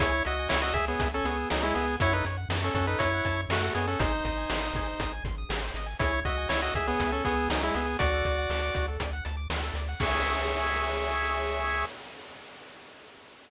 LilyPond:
<<
  \new Staff \with { instrumentName = "Lead 1 (square)" } { \time 4/4 \key cis \minor \tempo 4 = 120 <e' cis''>8 <fis' dis''>8 <e' cis''>16 <fis' dis''>16 <gis' e''>16 <b gis'>8 <cis' a'>16 <b gis'>8 <fis dis'>16 <gis e'>16 <b gis'>8 | <e' cis''>16 <dis' b'>16 r8. <cis' a'>16 <cis' a'>16 <dis' b'>16 <e' cis''>4 <a fis'>8 <b gis'>16 <cis' a'>16 | <dis' bis'>2~ <dis' bis'>8 r4. | <e' cis''>8 <fis' dis''>8 <e' cis''>16 <fis' dis''>16 <gis' e''>16 <b gis'>8 <cis' a'>16 <b gis'>8 <fis dis'>16 <gis e'>16 <b gis'>8 |
<fis' d''>2 r2 | cis''1 | }
  \new Staff \with { instrumentName = "Lead 1 (square)" } { \time 4/4 \key cis \minor gis'16 cis''16 e''16 gis''16 cis'''16 e'''16 gis'16 cis''16 e''16 gis''16 cis'''16 e'''16 gis'16 cis''16 e''16 gis''16 | fis'16 a'16 cis''16 fis''16 a''16 cis'''16 fis'16 a'16 cis''16 fis''16 a''16 cis'''16 fis'16 a'16 cis''16 fis''16 | gis'16 bis'16 dis''16 gis''16 bis''16 dis'''16 gis'16 bis'16 dis''16 gis''16 bis''16 dis'''16 gis'16 bis'16 dis''16 gis''16 | gis'16 cis''16 e''16 gis''16 cis'''16 e'''16 gis'16 cis''16 e''16 gis''16 cis'''16 e'''16 gis'16 cis''16 e''16 gis''16 |
fis'16 a'16 d''16 fis''16 a''16 d'''16 fis'16 a'16 d''16 fis''16 a''16 d'''16 fis'16 a'16 d''16 fis''16 | <gis' cis'' e''>1 | }
  \new Staff \with { instrumentName = "Synth Bass 1" } { \clef bass \time 4/4 \key cis \minor cis,8 cis,8 cis,8 cis,8 cis,8 cis,8 cis,8 cis,8 | fis,8 fis,8 fis,8 fis,8 fis,8 fis,8 fis,8 fis,8 | gis,,8 gis,,8 gis,,8 gis,,8 gis,,8 gis,,8 gis,,8 gis,,8 | cis,8 cis,8 cis,8 cis,8 cis,8 cis,8 cis,8 cis,8 |
d,8 d,8 d,8 d,8 d,8 d,8 d,8 d,8 | cis,1 | }
  \new DrumStaff \with { instrumentName = "Drums" } \drummode { \time 4/4 <hh bd>8 hh8 sn8 <hh bd>8 <hh bd>8 hh8 sn8 hh8 | <hh bd>8 hh8 sn8 <hh bd>8 <hh bd>8 <hh bd>8 sn8 hh8 | <hh bd>8 <hh bd>8 sn8 <hh bd>8 <hh bd>8 <hh bd>8 sn8 hh8 | <hh bd>8 <hh bd>8 sn8 <hh bd>8 <hh bd>8 <hh bd>8 sn8 hh8 |
<hh bd>8 <hh bd>8 sn8 <hh bd>8 <hh bd>8 hh8 sn8 hh8 | <cymc bd>4 r4 r4 r4 | }
>>